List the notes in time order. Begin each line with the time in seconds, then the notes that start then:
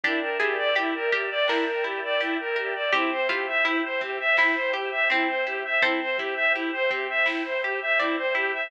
0.04 G1 D4 E4 G4 A#4 D5 E5 G5, kick, closed hi-hat
0.21 A#4
0.40 G1 E4 G4 G#4, kick, closed hi-hat
0.58 D5
0.75 G1 E4 G4, closed hi-hat
0.95 A#4
1.12 G1 G4 A#4, kick, closed hi-hat
1.30 D5
1.48 G1 D4 E4 A#4, snare
1.67 A#4
1.84 G1 E4 G4, closed hi-hat
2.04 D5
2.20 G1 E4 G4, closed hi-hat
2.39 A#4
2.56 G1 G4 A#4, closed hi-hat
2.75 D5
2.93 G1 C4 E4 G4 C5 E5 G5, kick, closed hi-hat
3.11 C5
3.29 G1 E4 F4 G4, kick, closed hi-hat
3.48 E5
3.65 G1 E4 G4, closed hi-hat
3.84 C5
4.01 G1 C4 G4, kick, closed hi-hat
4.20 E5
4.37 G1 E4, snare
4.55 C5
4.73 G1 G4, closed hi-hat
4.92 E5
5.10 G1 C4 E4, closed hi-hat
5.28 C5
5.46 G1 E4 G4, closed hi-hat
5.65 E5
5.82 C2 C4 E4 A4 C5 E5 G5, kick, closed hi-hat
6.00 C5
6.17 C2 E4 G4, kick, closed hi-hat
6.36 E5
6.54 C2 E4 G4, closed hi-hat
6.73 C5
6.91 C2 C4 G4, kick, closed hi-hat
7.10 E5
7.26 C2 E4, snare
7.45 C5
7.63 C2 G4, closed hi-hat
7.82 E5
7.99 C2 C4 E4 D5, closed hi-hat
8.17 C5
8.35 C2 E4 G4, closed hi-hat
8.54 E5